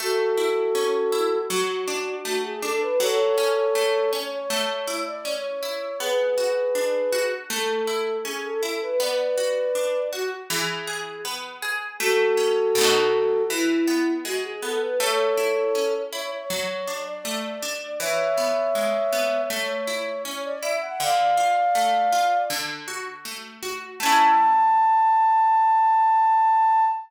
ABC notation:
X:1
M:4/4
L:1/16
Q:1/4=80
K:A
V:1 name="Flute"
[FA]8 F4 F G A B | [Ac]6 c c4 d c4 | [GB]8 A4 G A A B | [Bd]6 F z G4 z4 |
[FA]8 E4 F G A B | [Ac]6 c c4 d d4 | [ce]8 c4 c d e f | [d=f]8 z8 |
a16 |]
V:2 name="Orchestral Harp"
A,2 E2 C2 E2 F,2 D2 A,2 D2 | F,2 C2 A,2 C2 A,2 E2 C2 E2 | B,2 F2 D2 F2 A,2 E2 C2 E2 | B,2 F2 D2 F2 E,2 G2 B,2 G2 |
A,2 C2 [B,,A,^DF]4 E,2 B,2 G,2 B,2 | A,2 E2 C2 E2 F,2 D2 A,2 D2 | E,2 B,2 G,2 B,2 A,2 E2 C2 E2 | D,2 =F2 A,2 F2 D,2 ^F2 A,2 F2 |
[A,CE]16 |]